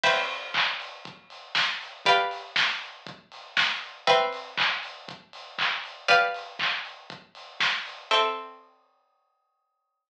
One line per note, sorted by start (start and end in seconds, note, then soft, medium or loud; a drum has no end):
0.03 2.01 C4 medium
0.03 2.01 B4 medium
0.03 2.01 E5 loud
0.03 2.01 G5 loud
0.03 kick loud
0.03 crash loud
0.30 open hi-hat medium
0.54 kick loud
0.54 clap loud
0.80 open hi-hat loud
1.05 kick loud
1.05 closed hi-hat loud
1.30 open hi-hat loud
1.55 kick loud
1.55 snare loud
1.81 open hi-hat loud
2.05 4.04 G4 medium
2.05 4.04 B4 loud
2.05 4.04 D5 medium
2.05 4.04 F5 medium
2.05 kick loud
2.05 closed hi-hat loud
2.31 open hi-hat loud
2.56 kick loud
2.56 snare loud
2.81 open hi-hat medium
3.07 kick loud
3.07 closed hi-hat loud
3.32 open hi-hat loud
3.57 kick loud
3.57 snare loud
3.82 open hi-hat medium
4.07 6.05 C4 loud
4.07 6.05 B4 medium
4.07 6.05 E5 medium
4.07 6.05 G5 medium
4.07 kick loud
4.07 closed hi-hat loud
4.33 open hi-hat loud
4.57 kick loud
4.57 clap loud
4.83 open hi-hat loud
5.08 kick loud
5.08 closed hi-hat loud
5.33 open hi-hat loud
5.58 kick loud
5.58 clap loud
5.84 open hi-hat loud
6.08 8.06 G4 loud
6.08 8.06 B4 medium
6.08 8.06 D5 loud
6.08 8.06 F5 loud
6.08 kick loud
6.08 closed hi-hat loud
6.34 open hi-hat loud
6.59 kick loud
6.59 clap loud
6.85 open hi-hat medium
7.10 kick loud
7.10 closed hi-hat loud
7.35 open hi-hat loud
7.60 kick loud
7.60 snare loud
7.86 open hi-hat loud
8.11 10.09 C4 medium
8.11 10.09 A4 medium
8.11 10.09 E5 medium
8.11 10.09 G5 medium